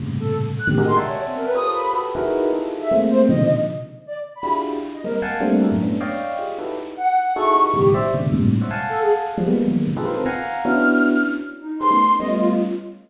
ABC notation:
X:1
M:5/8
L:1/16
Q:1/4=155
K:none
V:1 name="Electric Piano 1"
[G,,A,,^A,,C,^C,]6 z [^G,,=A,,^A,,=C,D,^D,] [^F=G^G^A]2 | [de^fg^ga]6 [=F=GA^Ac^c]4 | [^FGAB]2 [^DEF^G^AB]4 [DE=F=G^G=A]4 | [^G,A,^A,C]4 [^A,,B,,C,D,^D,F,]2 z4 |
z6 [DEF^FG^G]4 | z2 [G,^G,^A,C] z [f^f=g^g=a]2 [=G,=A,^A,CD]2 [E^FG=A^A] [^F,,^G,,=A,,] | [A,B,^CD]2 [^cd^dfg]4 [FG^G]2 [^DE^F=GAB]2 | z6 [^DE^F^GA]2 [EF=G^G^A]2 |
[G,,A,,B,,^C,^D,F,]2 [=c=de]2 [A,,B,,=C,^C,=D,^D,]2 [G,,^G,,A,,^A,,=C,]2 z [c^c=de^f] | [f^f^ga]6 z [=F,=G,^G,] [=G,^G,^A,B,]2 | [^D,F,^F,^G,^A,B,]2 [^A,,C,=D,] [^D=F=G^G=AB] [A^ABc]2 [f^f^g^a]4 | [B,^CDE^F]6 z4 |
z2 [G^G^ABc] [=A,B,^C^D] z2 [=G,A,B,C]4 |]
V:2 name="Flute"
z2 A2 z2 ^f' G ^d c' | z ^c z =C ^A B ^d'2 b2 | z9 e | z2 c C ^d2 z4 |
z2 d z2 b2 z3 | z ^d ^A z7 | z10 | z2 ^f4 ^c'3 z |
G2 z8 | z2 A ^G z6 | z4 F C z4 | f'6 z4 |
^D2 c'4 ^d F F z |]